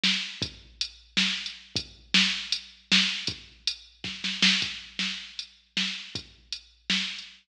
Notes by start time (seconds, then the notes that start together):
0.04 snare
0.42 kick, closed hi-hat
0.81 closed hi-hat
1.17 snare
1.46 closed hi-hat
1.76 kick, closed hi-hat
2.14 snare
2.52 closed hi-hat
2.92 snare
3.27 kick, closed hi-hat
3.67 closed hi-hat
4.04 kick, snare
4.24 snare
4.42 snare
4.62 kick, closed hi-hat
4.99 snare
5.39 closed hi-hat
5.77 snare
6.15 kick, closed hi-hat
6.52 closed hi-hat
6.90 snare
7.19 closed hi-hat